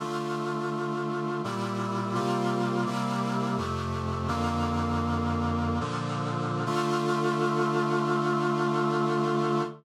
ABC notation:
X:1
M:3/4
L:1/8
Q:1/4=84
K:Dm
V:1 name="Brass Section"
[D,A,F]4 [B,,G,E]2 | [C,G,B,F]2 [C,G,B,E]2 [F,,C,A,]2 | "^rit." [F,,D,B,]4 [B,,D,F,]2 | [D,A,F]6 |]